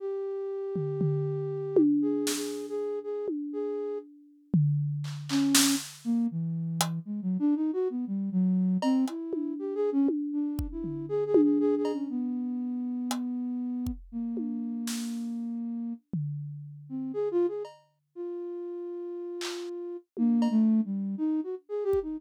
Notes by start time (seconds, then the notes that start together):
0.00 G4
0.76 floor tom
1.01 floor tom
1.76 high tom
2.02 G#4
2.27 snare
2.36 G#4
2.69 G#4
3.04 G#4
3.28 high tom
3.53 G#4
4.54 floor tom
5.04 clap
5.29 C#4, clap
5.55 snare
6.05 A#3
6.31 E3
6.81 closed hi-hat
7.05 G#3
7.22 F#3
7.39 D4
7.56 D#4
7.73 F#4
7.90 B3
8.07 G3
8.32 F#3
8.82 C4, cowbell
9.08 E4, closed hi-hat
9.33 high tom
9.59 G4
9.75 G#4
9.92 C#4
10.08 high tom
10.33 D4
10.59 kick
10.72 E4
10.84 floor tom
11.09 G#4
11.26 G#4
11.34 high tom
11.43 G#4
11.60 G#4
11.77 G#4
11.85 cowbell
11.93 C#4
12.10 B3
13.11 closed hi-hat
13.87 kick
14.12 A#3
14.37 high tom
14.87 snare
16.13 floor tom
16.89 C4
17.14 G#4
17.31 F4
17.48 G#4
17.65 cowbell
18.15 F4
19.41 clap
20.17 A#3, high tom
20.42 cowbell
20.51 A3
20.85 G3
21.18 D#4
21.44 F#4
21.69 G#4
21.84 G4
21.93 kick
22.02 D#4